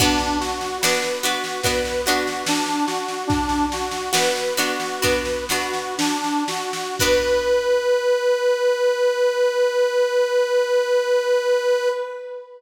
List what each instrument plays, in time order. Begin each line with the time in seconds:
0.00 orchestral harp B3 D4 F#4, accordion D4, kick, snare, crash
0.19 snare
0.40 accordion F#4, snare
0.61 snare
0.81 orchestral harp B3 D4 F#4, accordion B4, snare
1.02 snare
1.23 orchestral harp B3 D4 F#4, accordion F#4, snare
1.44 snare
1.63 orchestral harp B3 D4 F#4, accordion B4, kick, snare
1.85 snare
2.06 orchestral harp B3 D4 F#4, accordion F#4, snare
2.27 snare
2.46 accordion D4, snare
2.66 snare
2.87 accordion F#4, snare
3.08 snare
3.27 accordion D4, kick, snare
3.49 snare
3.72 accordion F#4, snare
3.91 snare
4.13 orchestral harp B3 D4 F#4, accordion B4, snare
4.36 snare
4.57 orchestral harp B3 D4 F#4, accordion F#4, snare
4.80 snare
5.01 orchestral harp B3 D4 F#4, accordion B4, kick, snare
5.25 snare
5.49 orchestral harp B3 D4 F#4, accordion F#4, snare
5.74 snare
5.98 accordion D4, snare
6.24 snare
6.48 accordion F#4, snare
6.73 snare
6.99 orchestral harp B3 D4 F#4, accordion B4, kick, crash